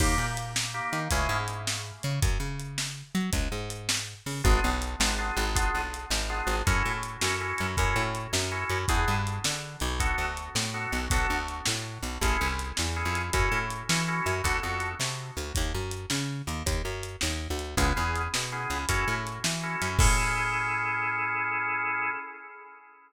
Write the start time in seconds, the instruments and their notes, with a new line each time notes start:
0.00 electric bass (finger) D#2, drawbar organ A#3 D#4 G4, kick, crash
0.18 electric bass (finger) A#2
0.37 closed hi-hat
0.56 snare
0.74 drawbar organ A#3 D#4 G4
0.93 electric bass (finger) D#3, closed hi-hat
1.11 electric bass (finger) C#2, drawbar organ A3 C#4 E4 G#4, kick, closed hi-hat
1.29 electric bass (finger) G#2
1.48 closed hi-hat
1.67 snare
2.03 electric bass (finger) C#3, closed hi-hat
2.22 electric bass (finger) F#2, kick, closed hi-hat
2.40 electric bass (finger) C#3
2.59 closed hi-hat
2.78 snare
3.15 electric bass (finger) F#3, closed hi-hat
3.33 electric bass (finger) C#2, kick, closed hi-hat
3.52 electric bass (finger) G#2
3.70 closed hi-hat
3.89 snare
4.26 electric bass (finger) C#3, open hi-hat
4.44 electric bass (finger) G#1, drawbar organ B3 D4 F4 G#4, kick, closed hi-hat
4.64 electric bass (finger) B1
4.82 closed hi-hat
5.00 electric bass (finger) G#1, drawbar organ B3 D4 F4 G#4, snare
5.18 drawbar organ B3 D4 F4 G#4
5.37 electric bass (finger) G#1, closed hi-hat
5.56 drawbar organ B3 D4 F4 G#4, kick, closed hi-hat
5.75 electric bass (finger) B1
5.94 closed hi-hat
6.10 electric bass (finger) G#1, snare
6.30 drawbar organ B3 D4 F4 G#4
6.47 electric bass (finger) G#1, closed hi-hat
6.67 electric bass (finger) F#2, drawbar organ C#4 E4 F#4 A4, kick, closed hi-hat
6.85 electric bass (finger) A2
7.03 closed hi-hat
7.21 electric bass (finger) F#2, drawbar organ C#4 E4 F#4 A4, snare
7.41 drawbar organ C#4 E4 F#4 A4
7.58 electric bass (finger) F#2, closed hi-hat
7.77 electric bass (finger) F#2, drawbar organ C#4 E4 F#4 A4, kick, closed hi-hat
7.96 electric bass (finger) A2
8.15 closed hi-hat
8.33 electric bass (finger) F#2, snare
8.52 drawbar organ C#4 E4 F#4 A4
8.70 electric bass (finger) F#2, closed hi-hat
8.88 electric bass (finger) E2, drawbar organ B3 D4 E4 G#4, kick, closed hi-hat
9.08 electric bass (finger) G2
9.27 closed hi-hat
9.44 electric bass (finger) D3, snare
9.80 electric bass (finger) B1, closed hi-hat
10.00 drawbar organ B3 D4 F#4 A4, kick, closed hi-hat
10.18 electric bass (finger) D2
10.37 closed hi-hat
10.55 electric bass (finger) A2, snare
10.74 drawbar organ B3 D4 F#4 A4
10.92 electric bass (finger) B1, closed hi-hat
11.10 electric bass (finger) B1, drawbar organ B3 D4 F#4 A4, kick, closed hi-hat
11.30 electric bass (finger) D2
11.48 closed hi-hat
11.66 electric bass (finger) A2, snare
12.03 electric bass (finger) B1, closed hi-hat
12.21 electric bass (finger) A1, drawbar organ C#4 E4 G#4 A4, kick, closed hi-hat
12.41 electric bass (finger) C2
12.59 closed hi-hat
12.77 electric bass (finger) E2, snare
12.96 drawbar organ C#4 E4 G#4 A4
13.05 electric bass (finger) F2
13.15 closed hi-hat
13.33 electric bass (finger) F#2, drawbar organ C#4 E4 F#4 A4, kick, closed hi-hat
13.52 electric bass (finger) A2
13.70 closed hi-hat
13.89 electric bass (finger) E3, drawbar organ C#4 E4 F#4 A4, snare
14.08 drawbar organ C#4 E4 F#4 A4
14.26 electric bass (finger) F#2, closed hi-hat
14.44 electric bass (finger) D2, drawbar organ B3 D4 F#4 A4, kick, closed hi-hat
14.63 electric bass (finger) F2, drawbar organ B3 D4 F#4 A4
14.80 closed hi-hat
15.00 electric bass (finger) C3, snare
15.37 electric bass (finger) D2, closed hi-hat
15.55 electric bass (finger) D#2, kick, closed hi-hat
15.74 electric bass (finger) F#2
15.91 closed hi-hat
16.10 electric bass (finger) C#3, snare
16.47 electric bass (finger) D#2, closed hi-hat
16.66 electric bass (finger) D#2, kick, closed hi-hat
16.85 electric bass (finger) F#2
17.03 closed hi-hat
17.21 electric bass (finger) D#2, snare
17.50 electric bass (finger) D2
17.59 closed hi-hat
17.77 electric bass (finger) C#2, drawbar organ B3 C#4 E4 G#4, kick, closed hi-hat
17.96 electric bass (finger) E2, drawbar organ B3 C#4 E4 G#4
18.16 closed hi-hat
18.34 electric bass (finger) B2, snare
18.52 drawbar organ B3 C#4 E4 G#4
18.70 electric bass (finger) C#2, closed hi-hat
18.89 electric bass (finger) F#2, drawbar organ C#4 E4 F#4 A4, kick, closed hi-hat
19.08 electric bass (finger) A2
19.27 closed hi-hat
19.44 electric bass (finger) E3, snare
19.63 drawbar organ C#4 E4 F#4 A4
19.82 electric bass (finger) F#2, closed hi-hat
19.99 electric bass (finger) A2, drawbar organ C#4 E4 G#4 A4, kick, crash